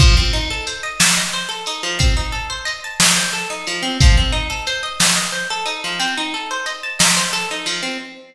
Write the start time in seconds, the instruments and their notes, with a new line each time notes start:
0.00 acoustic guitar (steel) F3, kick, crash
0.17 acoustic guitar (steel) C4
0.33 acoustic guitar (steel) D#4
0.50 acoustic guitar (steel) A4
0.67 acoustic guitar (steel) C5, closed hi-hat
0.83 acoustic guitar (steel) D#5
1.00 acoustic guitar (steel) A5, snare
1.17 acoustic guitar (steel) D#5
1.33 acoustic guitar (steel) C5
1.49 acoustic guitar (steel) A4
1.66 acoustic guitar (steel) D#4, closed hi-hat
1.83 acoustic guitar (steel) F3
1.99 acoustic guitar (steel) C4, kick, closed hi-hat
2.17 acoustic guitar (steel) D#4
2.32 acoustic guitar (steel) A4
2.50 acoustic guitar (steel) C5
2.65 acoustic guitar (steel) D#5, closed hi-hat
2.84 acoustic guitar (steel) A5
3.00 acoustic guitar (steel) D#5, snare
3.17 acoustic guitar (steel) C5
3.33 acoustic guitar (steel) A4
3.50 acoustic guitar (steel) D#4
3.67 acoustic guitar (steel) F3, closed hi-hat
3.83 acoustic guitar (steel) C4
4.00 acoustic guitar (steel) F3, kick, closed hi-hat
4.17 acoustic guitar (steel) C4
4.32 acoustic guitar (steel) D#4
4.50 acoustic guitar (steel) A4
4.67 acoustic guitar (steel) C5, closed hi-hat
4.83 acoustic guitar (steel) D#5
5.00 acoustic guitar (steel) A5, snare
5.15 acoustic guitar (steel) D#5
5.32 acoustic guitar (steel) C5
5.50 acoustic guitar (steel) A4
5.66 acoustic guitar (steel) D#4, closed hi-hat
5.84 acoustic guitar (steel) F3
6.00 acoustic guitar (steel) C4, closed hi-hat
6.18 acoustic guitar (steel) D#4
6.34 acoustic guitar (steel) A4
6.51 acoustic guitar (steel) C5
6.66 acoustic guitar (steel) D#5, closed hi-hat
6.83 acoustic guitar (steel) A5
6.99 acoustic guitar (steel) D#5, snare
7.17 acoustic guitar (steel) C5
7.33 acoustic guitar (steel) A4
7.51 acoustic guitar (steel) D#4
7.66 acoustic guitar (steel) F3, open hi-hat
7.83 acoustic guitar (steel) C4